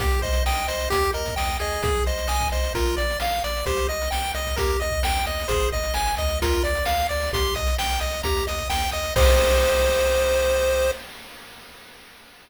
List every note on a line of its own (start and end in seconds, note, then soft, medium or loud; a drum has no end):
0.00 0.19 C2 medium
0.00 0.20 G4 medium
0.00 0.21 G4 loud
0.00 kick medium
0.00 closed hi-hat medium
0.11 closed hi-hat medium
0.22 0.42 C2 medium
0.22 0.43 C5 loud
0.22 0.44 D#5 medium
0.22 kick medium
0.22 closed hi-hat medium
0.33 closed hi-hat medium
0.46 0.66 C2 medium
0.46 0.66 D#5 loud
0.46 0.67 G5 medium
0.46 snare medium
0.55 closed hi-hat medium
0.68 0.88 C2 medium
0.68 0.89 C5 loud
0.68 0.89 D#5 medium
0.68 closed hi-hat medium
0.80 closed hi-hat medium
0.90 1.11 D#2 medium
0.90 1.11 G4 medium
0.90 1.11 G4 loud
0.90 kick medium
0.90 closed hi-hat medium
1.03 closed hi-hat medium
1.13 1.35 D#2 medium
1.13 1.35 A#4 loud
1.13 1.35 D#5 medium
1.13 closed hi-hat medium
1.26 kick medium
1.26 closed hi-hat medium
1.36 1.57 D#2 medium
1.36 1.58 D#5 medium
1.36 1.57 G5 medium
1.36 snare medium
1.48 closed hi-hat medium
1.59 1.80 D#2 medium
1.59 2.03 G#4 loud
1.59 1.82 D#5 medium
1.59 closed hi-hat medium
1.72 closed hi-hat medium
1.83 2.02 C2 medium
1.83 2.05 G#4 medium
1.83 kick loud
1.83 closed hi-hat medium
1.95 closed hi-hat medium
2.06 2.26 C2 medium
2.06 2.27 C5 medium
2.06 2.28 D#5 medium
2.06 closed hi-hat medium
2.18 closed hi-hat medium
2.28 2.48 C2 medium
2.28 2.48 D#5 loud
2.28 2.50 G#5 medium
2.28 snare medium
2.40 kick medium
2.40 closed hi-hat medium
2.52 2.71 C2 medium
2.52 2.73 C5 medium
2.52 2.73 D#5 medium
2.52 closed hi-hat medium
2.64 closed hi-hat medium
2.74 2.94 A#1 medium
2.74 2.96 F4 medium
2.74 2.95 A#4 loud
2.74 kick medium
2.74 closed hi-hat medium
2.85 closed hi-hat medium
2.97 3.17 A#1 medium
2.97 3.17 D5 medium
2.97 3.19 D5 medium
2.97 closed hi-hat medium
3.10 closed hi-hat medium
3.20 3.40 A#1 medium
3.20 3.41 F5 medium
3.20 3.43 F5 medium
3.20 snare medium
3.32 closed hi-hat medium
3.44 3.63 A#1 medium
3.44 3.65 D5 loud
3.44 3.65 D5 medium
3.44 closed hi-hat medium
3.57 closed hi-hat medium
3.66 3.86 C2 loud
3.66 3.87 G4 medium
3.66 3.87 C5 loud
3.66 kick medium
3.66 closed hi-hat medium
3.77 closed hi-hat medium
3.88 4.08 C2 medium
3.88 4.09 D#5 medium
3.88 4.10 D#5 medium
3.88 closed hi-hat medium
4.02 closed hi-hat medium
4.11 4.32 C2 medium
4.11 4.32 G5 medium
4.11 4.33 G5 loud
4.11 snare medium
4.24 closed hi-hat medium
4.34 4.54 C2 medium
4.34 4.56 D#5 medium
4.34 closed hi-hat medium
4.45 kick medium
4.45 closed hi-hat medium
4.56 4.77 D#2 medium
4.56 4.79 G4 medium
4.56 4.77 A#4 loud
4.56 kick medium
4.56 closed hi-hat medium
4.68 closed hi-hat medium
4.80 5.01 D#2 medium
4.80 5.00 D#5 medium
4.80 5.03 D#5 medium
4.80 closed hi-hat medium
4.90 kick medium
4.90 closed hi-hat soft
5.03 5.22 D#2 medium
5.03 5.24 G5 medium
5.03 5.26 G5 medium
5.03 snare loud
5.15 closed hi-hat medium
5.25 5.46 D#2 medium
5.25 5.47 D#5 medium
5.25 5.48 D#5 medium
5.25 closed hi-hat medium
5.39 closed hi-hat medium
5.48 5.69 G#1 medium
5.48 5.70 G#4 medium
5.48 5.69 C5 loud
5.48 kick medium
5.48 closed hi-hat medium
5.60 closed hi-hat medium
5.72 5.91 G#1 medium
5.72 5.93 D#5 medium
5.72 5.94 D#5 medium
5.72 kick medium
5.72 closed hi-hat medium
5.83 closed hi-hat medium
5.94 6.15 G#1 medium
5.94 6.15 G#5 medium
5.94 6.16 G#5 medium
5.94 snare medium
6.06 closed hi-hat medium
6.17 6.61 D2 loud
6.17 6.39 D#5 medium
6.17 6.40 D#5 medium
6.17 kick medium
6.17 closed hi-hat medium
6.28 closed hi-hat medium
6.42 6.63 F4 medium
6.42 6.63 A#4 loud
6.42 kick medium
6.42 closed hi-hat medium
6.53 closed hi-hat medium
6.64 6.83 D2 medium
6.64 6.85 D5 medium
6.64 closed hi-hat medium
6.75 closed hi-hat medium
6.85 7.07 D2 medium
6.85 7.07 F5 medium
6.85 snare medium
7.00 closed hi-hat medium
7.09 7.30 D2 medium
7.09 7.30 D5 medium
7.09 7.32 D5 medium
7.09 closed hi-hat medium
7.20 open hi-hat medium
7.33 7.52 C2 medium
7.33 7.54 G4 medium
7.33 7.54 C6 loud
7.33 kick medium
7.33 closed hi-hat medium
7.45 closed hi-hat medium
7.55 7.75 C2 medium
7.55 7.77 D#5 medium
7.55 7.75 D#6 medium
7.55 kick medium
7.55 closed hi-hat medium
7.67 closed hi-hat medium
7.78 7.98 C2 medium
7.78 8.00 G5 medium
7.78 8.00 G6 medium
7.78 snare medium
7.90 closed hi-hat medium
8.00 8.21 C2 medium
8.00 8.22 D#5 medium
8.00 8.21 D#6 medium
8.00 closed hi-hat medium
8.11 closed hi-hat medium
8.23 8.43 D#2 medium
8.23 8.46 G4 medium
8.23 8.44 A#5 loud
8.23 kick medium
8.23 closed hi-hat medium
8.37 closed hi-hat medium
8.47 8.67 D#2 medium
8.47 8.68 D#5 medium
8.47 8.69 D#6 medium
8.47 closed hi-hat medium
8.58 kick medium
8.58 closed hi-hat medium
8.69 8.89 D#2 medium
8.69 8.91 G5 medium
8.69 8.91 G6 medium
8.69 snare medium
8.82 closed hi-hat medium
8.91 9.12 D#2 medium
8.91 9.14 D#5 medium
8.91 9.13 D#6 loud
8.91 closed hi-hat medium
9.03 closed hi-hat medium
9.16 10.91 C2 loud
9.16 10.91 G4 medium
9.16 10.91 C5 loud
9.16 10.91 D#5 loud
9.16 kick loud
9.16 crash loud